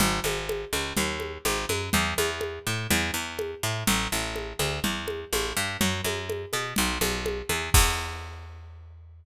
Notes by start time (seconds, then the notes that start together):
0.00 G#1, low conga
0.24 G#1, high conga
0.49 high conga
0.73 C#2, high conga
0.97 D#2, low conga
1.20 high conga
1.45 G#1, high conga
1.69 F#2, high conga
1.93 E2, low conga
2.18 E2, high conga
2.41 high conga
2.67 A2
2.90 E2, low conga
3.14 E2
3.39 high conga
3.63 A2
3.87 A1, low conga
4.12 A1
4.36 high conga
4.59 D2, high conga
4.84 E2, low conga
5.08 high conga
5.33 A1, high conga
5.57 G2
5.81 F#2, low conga
6.04 F#2, high conga
6.30 high conga
6.53 B2, high conga
6.76 B1, low conga
7.01 B1, high conga
7.26 high conga
7.49 E2, high conga
7.74 E2, kick, crash